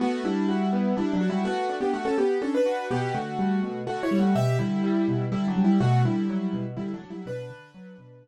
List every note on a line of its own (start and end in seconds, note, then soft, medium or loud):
0.00 0.23 A3 medium
0.00 0.22 B3 medium
0.00 0.23 F#4 medium
0.24 0.93 G3 medium
0.24 0.46 D4 medium
0.24 0.93 E4 medium
0.48 0.70 F#4 medium
0.73 0.95 B3 medium
0.97 1.13 G3 medium
0.97 1.18 D4 medium
0.97 1.13 E4 medium
1.14 1.29 F#3 medium
1.14 1.29 D4 medium
1.21 1.43 F#4 medium
1.30 1.45 G3 medium
1.30 1.45 E4 medium
1.45 1.76 A3 medium
1.45 1.67 B3 medium
1.45 1.76 F#4 medium
1.69 1.91 D4 medium
1.81 1.92 B3 medium
1.81 1.92 G4 medium
1.93 2.05 A3 medium
1.93 2.05 F#4 medium
2.05 2.17 C#4 medium
2.05 2.17 A4 medium
2.18 2.39 B3 medium
2.18 2.39 G4 medium
2.42 2.53 C#4 medium
2.42 2.64 D4 medium
2.42 2.53 A4 medium
2.55 2.86 D4 medium
2.55 2.86 B4 medium
2.66 2.88 F#4 medium
2.90 3.12 B2 medium
2.90 3.14 B3 medium
2.90 3.14 G4 medium
3.15 3.36 D3 medium
3.15 3.79 A3 medium
3.15 3.79 F#4 medium
3.39 3.61 G3 medium
3.63 3.85 B2 medium
3.87 4.09 D3 medium
3.87 4.02 A3 medium
3.87 4.02 F#4 medium
4.03 4.18 E4 medium
4.03 4.18 C#5 medium
4.11 4.33 G3 medium
4.19 4.35 A3 medium
4.19 4.35 F#4 medium
4.35 4.57 B2 medium
4.35 4.57 G4 medium
4.35 4.57 E5 medium
4.59 4.82 D3 medium
4.59 5.24 G3 medium
4.59 5.24 E4 medium
4.84 5.06 G3 medium
5.08 5.30 B2 medium
5.32 5.54 D3 medium
5.32 5.47 G3 medium
5.32 5.47 E4 medium
5.48 5.63 F#3 medium
5.48 5.63 D4 medium
5.56 5.78 G3 medium
5.64 5.80 G3 medium
5.64 5.80 E4 medium
5.80 6.02 B2 medium
5.80 6.02 A3 medium
5.80 6.02 F#4 medium
6.05 6.27 D3 medium
6.05 6.64 G3 medium
6.05 6.64 E4 medium
6.29 6.51 F#3 medium
6.53 6.75 B2 medium
6.77 6.99 D3 medium
6.77 6.92 G3 medium
6.77 6.92 E4 medium
6.94 7.09 F#3 medium
6.94 7.09 D4 medium
7.02 7.24 F#3 medium
7.10 7.26 G3 medium
7.10 7.26 E4 medium
7.26 7.48 B2 medium
7.26 8.28 D4 medium
7.26 8.28 B4 medium
7.50 7.72 D3 medium
7.74 7.96 F#3 medium
7.98 8.20 B2 medium
8.22 8.28 D3 medium